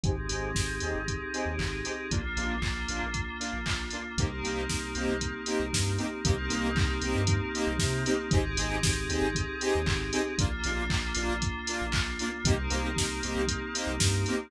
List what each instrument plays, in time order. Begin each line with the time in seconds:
0.04 synth bass 2 G#1, lead 2 (sawtooth) C4 D#4 G4 G#4, pad 5 (bowed) C4 D#4 G4 G#4, kick, closed hi-hat
0.29 synth bass 2 G#1, lead 2 (sawtooth) C4 D#4 G4 G#4, open hi-hat
0.55 synth bass 2 G#1, kick, snare
0.80 synth bass 2 D#2, lead 2 (sawtooth) C4 D#4 G4 G#4, open hi-hat
0.95 synth bass 2 G#1
1.08 kick, closed hi-hat
1.34 lead 2 (sawtooth) C4 D#4 G4 G#4, open hi-hat
1.46 synth bass 2 D#2
1.58 synth bass 2 G#1, kick, clap
1.85 lead 2 (sawtooth) C4 D#4 G4 G#4, open hi-hat
2.11 synth bass 2 A#1, pad 5 (bowed) A#3 D4 F4, lead 2 (sawtooth) A#3 D4 F4, kick, closed hi-hat
2.37 synth bass 2 A#1, lead 2 (sawtooth) A#3 D4 F4, open hi-hat
2.62 synth bass 2 A#1, kick, clap
2.88 synth bass 2 A#1, lead 2 (sawtooth) A#3 D4 F4, open hi-hat
3.03 synth bass 2 A#1
3.14 kick, closed hi-hat
3.40 lead 2 (sawtooth) A#3 D4 F4, open hi-hat
3.53 synth bass 2 A#1
3.66 synth bass 2 A#1, kick, clap
3.91 lead 2 (sawtooth) A#3 D4 F4, open hi-hat
4.17 synth bass 2 C2, pad 5 (bowed) A#3 C4 D#4 G4, lead 2 (sawtooth) A#3 C4 D#4 G4, kick, closed hi-hat
4.43 synth bass 2 C2, lead 2 (sawtooth) A#3 C4 D#4 G4, open hi-hat
4.69 synth bass 2 C2, kick, snare
4.95 synth bass 2 C2, lead 2 (sawtooth) A#3 C4 D#4 G4, open hi-hat
5.09 synth bass 2 C2
5.21 kick, closed hi-hat
5.46 lead 2 (sawtooth) A#3 C4 D#4 G4, open hi-hat
5.60 synth bass 2 C2
5.73 synth bass 2 G2, kick, snare
5.98 lead 2 (sawtooth) A#3 C4 D#4 G4, open hi-hat
6.24 synth bass 2 C2, pad 5 (bowed) A#3 C4 D#4 G4, lead 2 (sawtooth) A#3 C4 D#4 G4, kick, closed hi-hat
6.50 synth bass 2 C2, lead 2 (sawtooth) A#3 C4 D#4 G4, open hi-hat
6.75 synth bass 2 C2, kick, clap
7.02 synth bass 2 C2, lead 2 (sawtooth) A#3 C4 D#4 G4, open hi-hat
7.15 synth bass 2 G2
7.27 kick, closed hi-hat
7.55 lead 2 (sawtooth) A#3 C4 D#4 G4, open hi-hat
7.67 synth bass 2 C2
7.78 synth bass 2 C3, kick, snare
8.05 lead 2 (sawtooth) A#3 C4 D#4 G4, open hi-hat
8.31 synth bass 2 G#1, pad 5 (bowed) C4 D#4 G4 G#4, lead 2 (sawtooth) C4 D#4 G4 G#4, kick, closed hi-hat
8.57 synth bass 2 G#1, lead 2 (sawtooth) C4 D#4 G4 G#4, open hi-hat
8.83 synth bass 2 G#1, kick, snare
9.09 synth bass 2 D#2, lead 2 (sawtooth) C4 D#4 G4 G#4, open hi-hat
9.21 synth bass 2 G#1
9.35 kick, closed hi-hat
9.61 lead 2 (sawtooth) C4 D#4 G4 G#4, open hi-hat
9.75 synth bass 2 D#2
9.86 synth bass 2 G#1, kick, clap
10.13 lead 2 (sawtooth) C4 D#4 G4 G#4, open hi-hat
10.38 synth bass 2 A#1, pad 5 (bowed) A#3 D4 F4, lead 2 (sawtooth) A#3 D4 F4, kick, closed hi-hat
10.64 synth bass 2 A#1, lead 2 (sawtooth) A#3 D4 F4, open hi-hat
10.90 synth bass 2 A#1, kick, clap
11.15 synth bass 2 A#1, lead 2 (sawtooth) A#3 D4 F4, open hi-hat
11.29 synth bass 2 A#1
11.42 kick, closed hi-hat
11.67 lead 2 (sawtooth) A#3 D4 F4, open hi-hat
11.81 synth bass 2 A#1
11.92 synth bass 2 A#1, kick, clap
12.19 lead 2 (sawtooth) A#3 D4 F4, open hi-hat
12.44 synth bass 2 C2, lead 2 (sawtooth) A#3 C4 D#4 G4, pad 5 (bowed) A#3 C4 D#4 G4, kick, closed hi-hat
12.70 synth bass 2 C2, lead 2 (sawtooth) A#3 C4 D#4 G4, open hi-hat
12.96 synth bass 2 C2, kick, snare
13.23 synth bass 2 C2, lead 2 (sawtooth) A#3 C4 D#4 G4, open hi-hat
13.36 synth bass 2 C2
13.48 kick, closed hi-hat
13.74 lead 2 (sawtooth) A#3 C4 D#4 G4, open hi-hat
13.87 synth bass 2 C2
14.00 synth bass 2 G2, kick, snare
14.26 lead 2 (sawtooth) A#3 C4 D#4 G4, open hi-hat